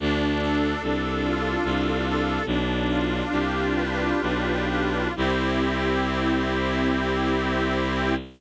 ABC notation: X:1
M:3/4
L:1/8
Q:1/4=73
K:C
V:1 name="Accordion"
D A D F D A | "^rit." D F G B D F | [CEG]6 |]
V:2 name="Violin" clef=bass
D,,2 C,,2 C,,2 | "^rit." B,,,2 C,,2 B,,,2 | C,,6 |]